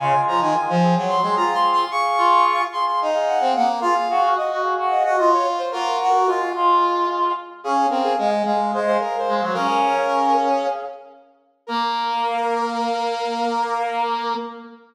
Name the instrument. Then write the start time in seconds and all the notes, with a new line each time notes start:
brass section
0.00 C#3 G#3 F4 G#5
0.28 F3 A#5
0.41 D#3 G#5
0.55 G#5
0.69 F3
0.82 C4 G#4
0.97 F#3
1.09 C6
1.22 G#3 C4 G#4 C6
1.36 F4 A#5
1.54 C6
1.72 C6
1.91 G#4 F5 C#6
2.17 F4
2.72 G#4 F5 C6
2.87 C6
3.01 D#4
3.14 G#4 F5
3.28 F#5
3.40 C4
3.55 A#3 F#5
3.68 F5
3.81 F4 G#4 F5
4.09 F#4 G#4 F5
4.23 F#4
4.37 F#4 D#5
4.51 F#4
4.63 G#4 F5
4.78 F#4
4.91 D#5
5.04 F#4 D#5
5.18 F4 F#4 D#5
5.33 C#5
5.58 C5
5.72 A#3 F4 F#4 A#4
6.01 F#4
6.14 A#4
6.27 G#3 F4
6.55 G#3 F4
7.64 C#4 G#4 F5
7.89 C4 A#4
8.03 G#4
8.18 G#3 G#4
8.45 G#3 G#4 F5
8.74 G#3 C5
8.86 G#4 C5 F5
9.00 A#4
9.18 C5
9.28 G#3
9.36 C5
9.41 F#3
9.54 C#4 G#4 A#4 F5
9.67 G#4 F5
9.82 G#4 F5
9.96 G#4 F5
11.67 A#3 A#4